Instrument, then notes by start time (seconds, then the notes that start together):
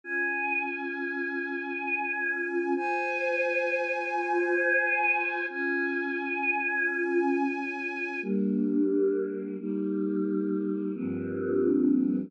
choir aahs
0.04 C#4 F4 G#5
2.76 F4 C5 G#5
5.50 C#4 F4 G#5
8.22 G3 A#3 D4
9.59 G3 A#3 D#4
10.94 G2 F3 A#3 C4 D4